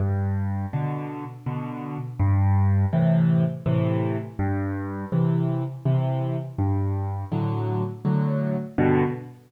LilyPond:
\new Staff { \clef bass \time 3/4 \key g \major \tempo 4 = 82 g,4 <b, d>4 <b, d>4 | g,4 <a, c e>4 <a, c e>4 | g,4 <c e>4 <c e>4 | g,4 <a, d fis>4 <a, d fis>4 |
<g, b, d>4 r2 | }